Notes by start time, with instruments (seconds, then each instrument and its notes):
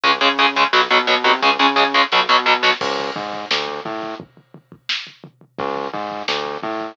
0.04 synth bass 1 C#2, overdriven guitar C#3 G#3, kick, closed hi-hat
0.12 closed hi-hat
0.21 synth bass 1 C#3, overdriven guitar C#3 G#3, closed hi-hat
0.30 closed hi-hat
0.38 overdriven guitar C#3 G#3, closed hi-hat
0.47 closed hi-hat
0.56 overdriven guitar C#3 G#3, closed hi-hat
0.64 closed hi-hat
0.73 synth bass 1 B1, overdriven guitar B2 F#3, snare
0.82 closed hi-hat
0.90 overdriven guitar B2 F#3, synth bass 1 B2, closed hi-hat
0.99 closed hi-hat
1.07 overdriven guitar B2 F#3, synth bass 1 B2, closed hi-hat
1.16 closed hi-hat
1.24 overdriven guitar B2 F#3, synth bass 1 C3, kick, closed hi-hat
1.33 closed hi-hat
1.42 synth bass 1 C#2, overdriven guitar C#3 G#3, kick, snare
1.59 overdriven guitar C#3 G#3, synth bass 1 C#3, snare
1.76 overdriven guitar C#3 G#3, snare
1.94 overdriven guitar C#3 G#3, snare
2.12 synth bass 1 B1, overdriven guitar B2 F#3, snare
2.29 overdriven guitar B2 F#3, synth bass 1 B2, snare
2.46 overdriven guitar B2 F#3
2.63 overdriven guitar B2 F#3, snare
2.81 synth bass 1 C#2, kick, crash
2.99 floor tom
3.16 synth bass 1 G#2, floor tom
3.33 floor tom
3.51 synth bass 1 D2, snare
3.68 floor tom
3.85 synth bass 1 A2, floor tom
4.02 floor tom
4.20 kick, floor tom
4.37 floor tom
4.54 floor tom
4.72 kick, floor tom
4.89 snare
5.07 floor tom
5.24 floor tom
5.41 floor tom
5.59 synth bass 1 C#2, kick, floor tom
5.76 floor tom
5.93 synth bass 1 G#2, floor tom
6.11 floor tom
6.28 synth bass 1 D2, snare
6.45 floor tom
6.63 synth bass 1 A2, floor tom
6.80 floor tom